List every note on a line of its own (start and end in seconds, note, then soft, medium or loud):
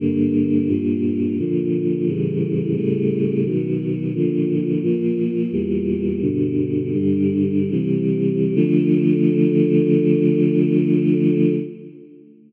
0.00 0.67 G2 medium
0.00 0.67 D3 medium
0.00 0.67 A#3 medium
0.68 1.36 G2 medium
0.68 1.36 A#2 medium
0.68 1.36 A#3 medium
1.39 2.07 A#2 medium
1.39 2.07 D3 medium
1.39 2.07 F3 medium
2.07 2.75 A2 medium
2.07 2.75 C#3 medium
2.07 2.75 E3 medium
2.07 2.75 G3 medium
2.76 3.44 A2 medium
2.76 3.44 C#3 medium
2.76 3.44 G3 medium
2.76 3.44 A3 medium
3.45 4.13 B2 medium
3.45 4.13 D#3 medium
3.45 4.13 F#3 medium
4.15 4.82 A#2 medium
4.15 4.83 D3 medium
4.15 4.82 F3 medium
4.82 5.51 A#2 medium
4.82 5.51 F3 medium
4.82 5.51 A#3 medium
5.52 6.20 E2 medium
5.52 6.20 A#2 medium
5.52 6.20 G3 medium
6.21 6.92 G2 medium
6.21 6.92 B2 medium
6.21 6.92 D3 medium
6.93 7.70 G2 medium
6.93 7.70 D3 medium
6.93 7.70 G3 medium
7.70 8.54 C3 medium
7.70 8.54 E3 medium
7.70 8.54 G3 medium
8.55 11.54 D3 loud
8.55 11.54 F3 loud
8.55 11.54 A3 loud